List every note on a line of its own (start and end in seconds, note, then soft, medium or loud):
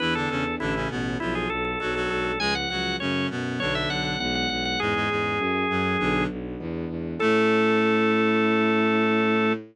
0.00 0.26 E2 medium
0.00 0.14 E3 medium
0.00 0.59 B3 medium
0.00 0.59 D4 medium
0.00 0.14 E4 medium
0.00 0.59 E4 medium
0.00 0.59 G#4 medium
0.00 0.14 B4 medium
0.15 0.29 D3 medium
0.15 0.29 D4 medium
0.15 0.29 A4 medium
0.29 0.55 E2 medium
0.29 0.44 C#3 medium
0.29 0.44 C#4 medium
0.29 0.55 A4 medium
0.60 0.86 A1 loud
0.60 0.74 D3 medium
0.60 1.19 C#4 medium
0.60 0.74 D4 medium
0.60 1.19 E4 medium
0.60 0.88 E4 medium
0.60 1.19 A4 medium
0.75 0.90 C#3 medium
0.75 0.90 C#4 medium
0.90 1.16 A1 medium
0.90 1.18 B2 medium
0.90 1.18 B3 medium
1.20 1.46 B1 medium
1.20 1.48 F3 medium
1.20 1.79 B3 medium
1.20 1.79 D4 medium
1.20 1.34 E4 medium
1.20 1.79 F4 medium
1.20 1.48 F4 medium
1.35 1.49 G#4 medium
1.50 1.76 B1 medium
1.50 1.64 A4 medium
1.65 1.79 A4 medium
1.80 2.07 B1 medium
1.80 1.94 F#3 medium
1.80 2.39 G#3 medium
1.80 2.39 B3 medium
1.80 2.39 D4 medium
1.80 1.94 F#4 medium
1.80 1.94 A4 medium
1.95 2.32 F#3 medium
1.95 2.32 F#4 medium
1.95 2.09 A4 medium
2.10 2.37 B1 medium
2.10 2.24 A4 medium
2.25 2.39 A4 medium
2.40 2.66 C#2 medium
2.40 2.99 F3 medium
2.40 2.54 G#3 medium
2.40 2.99 G#3 medium
2.40 2.99 C#4 medium
2.40 2.54 G#4 medium
2.40 2.54 G#5 medium
2.55 2.69 F#5 medium
2.70 2.96 C#2 medium
2.70 2.96 F#3 medium
2.70 2.96 F#4 medium
2.70 2.96 F#5 medium
3.00 3.25 F#2 medium
3.00 3.29 C#3 medium
3.00 3.59 F#3 medium
3.00 3.59 A3 medium
3.00 3.59 C#4 medium
3.00 3.29 C#4 medium
3.00 3.27 C#5 medium
3.30 3.57 F#2 medium
3.30 3.60 B2 medium
3.30 3.60 B3 medium
3.60 3.86 B1 medium
3.60 4.16 D3 medium
3.60 4.19 F#3 medium
3.60 4.19 B3 medium
3.60 4.16 D4 medium
3.60 4.19 D4 medium
3.60 3.74 C#5 medium
3.75 3.89 E5 medium
3.90 4.16 B1 medium
3.90 4.04 F#5 medium
4.05 4.19 F#5 medium
4.20 4.46 B1 medium
4.20 4.79 E3 medium
4.20 4.79 G#3 medium
4.20 4.79 B3 medium
4.20 4.79 D4 medium
4.20 4.34 F#5 medium
4.35 4.49 F#5 medium
4.50 4.76 B1 medium
4.50 4.64 F#5 medium
4.65 4.79 F#5 medium
4.80 5.05 E2 medium
4.80 4.94 G#2 medium
4.80 5.39 E3 medium
4.80 4.94 G#3 medium
4.80 5.39 G#3 medium
4.80 5.39 C#4 medium
4.80 6.24 G#4 loud
4.95 5.09 G#2 medium
4.95 5.09 G#3 medium
5.09 5.35 E2 medium
5.09 5.39 G#2 medium
5.09 5.39 G#3 medium
5.39 5.65 F#2 medium
5.39 5.99 F#3 medium
5.39 5.99 A3 medium
5.39 5.99 C#4 medium
5.70 5.97 F#2 medium
5.70 5.96 F#2 medium
5.70 5.97 F#3 medium
6.00 6.25 B1 loud
6.00 6.27 D3 medium
6.00 6.58 F#3 medium
6.00 6.58 B3 medium
6.00 6.27 D4 medium
6.00 6.58 D4 medium
6.30 6.56 B1 medium
6.60 6.85 E2 medium
6.60 7.19 E3 medium
6.60 7.19 G#3 medium
6.60 7.19 B3 medium
6.60 7.19 D4 medium
6.89 7.15 E2 medium
7.20 9.54 A2 loud
7.20 9.53 A3 loud
7.20 9.52 C#4 loud
7.20 9.52 E4 loud
7.20 9.52 A4 loud
7.20 9.53 A4 loud